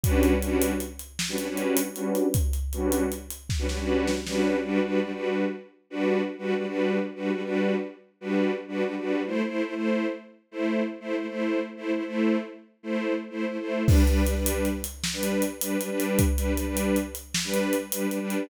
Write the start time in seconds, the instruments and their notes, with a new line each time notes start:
0.04 string ensemble 1 G3 C#4 D4 F#4 B4, kick, closed hi-hat
0.23 closed hi-hat
0.42 string ensemble 1 G3 C#4 D4 F#4 B4, closed hi-hat
0.62 closed hi-hat
0.80 closed hi-hat
0.99 closed hi-hat
1.19 snare
1.29 string ensemble 1 G3 C#4 D4 F#4 B4
1.38 string ensemble 1 G3 C#4 D4 F#4 B4, closed hi-hat
1.48 string ensemble 1 G3 C#4 D4 F#4 B4
1.57 closed hi-hat
1.77 closed hi-hat
1.96 string ensemble 1 G3 C#4 D4 F#4 B4, closed hi-hat
2.15 closed hi-hat
2.34 kick, closed hi-hat
2.53 closed hi-hat
2.73 string ensemble 1 G3 C#4 D4 F#4 B4, closed hi-hat
2.92 closed hi-hat
3.12 closed hi-hat
3.31 closed hi-hat
3.50 kick, snare
3.59 string ensemble 1 G3 C#4 D4 F#4 B4
3.69 string ensemble 1 G3 C#4 D4 F#4 B4, snare
3.79 string ensemble 1 G3 C#4 D4 F#4 B4
4.07 snare
4.27 string ensemble 1 G3 C#4 D4 F#4 B4, snare
4.64 string ensemble 1 G3 D4 F#4 B4
4.84 string ensemble 1 G3 D4 F#4 B4
5.04 string ensemble 1 G3 D4 F#4 B4
5.14 string ensemble 1 G3 D4 F#4 B4
5.90 string ensemble 1 G3 D4 F#4 B4
6.38 string ensemble 1 G3 D4 F#4 B4
6.58 string ensemble 1 G3 D4 F#4 B4
6.67 string ensemble 1 G3 D4 F#4 B4
7.15 string ensemble 1 G3 D4 F#4 B4
7.34 string ensemble 1 G3 D4 F#4 B4
7.44 string ensemble 1 G3 D4 F#4 B4
8.21 string ensemble 1 G3 D4 F#4 B4
8.68 string ensemble 1 G3 D4 F#4 B4
8.87 string ensemble 1 G3 D4 F#4 B4
8.98 string ensemble 1 G3 D4 F#4 B4
9.26 string ensemble 1 A3 E4 C5
9.47 string ensemble 1 A3 E4 C5
9.66 string ensemble 1 A3 E4 C5
9.75 string ensemble 1 A3 E4 C5
10.51 string ensemble 1 A3 E4 C5
11.00 string ensemble 1 A3 E4 C5
11.19 string ensemble 1 A3 E4 C5
11.29 string ensemble 1 A3 E4 C5
11.77 string ensemble 1 A3 E4 C5
11.96 string ensemble 1 A3 E4 C5
12.06 string ensemble 1 A3 E4 C5
12.83 string ensemble 1 A3 E4 C5
13.30 string ensemble 1 A3 E4 C5
13.50 string ensemble 1 A3 E4 C5
13.60 string ensemble 1 A3 E4 C5
13.87 string ensemble 1 G3 D4 B4, kick, crash
14.07 string ensemble 1 G3 D4 B4, closed hi-hat
14.27 string ensemble 1 G3 D4 B4, closed hi-hat
14.38 string ensemble 1 G3 D4 B4
14.46 closed hi-hat
14.65 closed hi-hat
14.84 closed hi-hat
15.04 snare
15.13 string ensemble 1 G3 D4 B4
15.23 closed hi-hat
15.42 closed hi-hat
15.61 string ensemble 1 G3 D4 B4, closed hi-hat
15.81 string ensemble 1 G3 D4 B4, closed hi-hat
15.90 string ensemble 1 G3 D4 B4
16.00 closed hi-hat
16.19 kick, closed hi-hat
16.37 string ensemble 1 G3 D4 B4, closed hi-hat
16.57 string ensemble 1 G3 D4 B4, closed hi-hat
16.67 string ensemble 1 G3 D4 B4
16.77 closed hi-hat
16.96 closed hi-hat
17.15 closed hi-hat
17.34 snare
17.44 string ensemble 1 G3 D4 B4
17.54 closed hi-hat
17.73 closed hi-hat
17.92 string ensemble 1 G3 D4 B4, closed hi-hat
18.11 string ensemble 1 G3 D4 B4, closed hi-hat
18.21 string ensemble 1 G3 D4 B4
18.30 closed hi-hat